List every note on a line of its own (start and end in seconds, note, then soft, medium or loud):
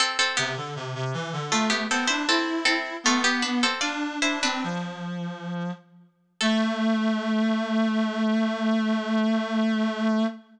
0.00 0.18 C4 loud
0.00 0.18 A4 loud
0.19 0.37 C4 medium
0.19 0.37 A4 loud
0.37 0.56 C3 medium
0.37 0.55 B3 medium
0.37 0.55 G4 loud
0.57 0.75 D3 medium
0.76 0.94 C3 medium
0.95 1.13 C3 medium
1.14 1.32 E3 medium
1.33 1.51 D3 medium
1.52 1.70 A3 medium
1.52 1.85 A3 medium
1.52 1.70 F4 medium
1.70 1.88 B3 medium
1.70 1.88 G4 medium
1.90 2.08 B3 medium
1.90 2.09 C4 medium
1.90 2.09 A4 medium
2.07 2.27 D4 medium
2.07 2.25 E4 medium
2.07 2.25 C5 loud
2.28 2.65 C4 medium
2.28 2.94 E4 medium
2.28 2.65 A4 medium
2.65 2.97 C4 medium
2.65 2.97 A4 loud
3.04 3.24 A3 medium
3.04 3.66 B3 medium
3.04 3.24 F4 loud
3.24 3.42 B3 medium
3.24 3.42 G4 loud
3.42 3.61 D4 medium
3.42 3.61 B4 medium
3.63 3.82 C4 medium
3.63 3.82 A4 medium
3.81 4.18 D4 medium
3.81 4.17 F4 medium
3.81 4.17 D5 medium
4.22 4.42 D4 medium
4.22 4.42 E4 medium
4.22 4.42 C5 loud
4.43 4.63 C4 medium
4.43 5.46 D4 medium
4.43 5.46 B4 loud
4.64 5.71 F3 medium
6.41 10.25 A3 loud
6.41 10.24 A4 loud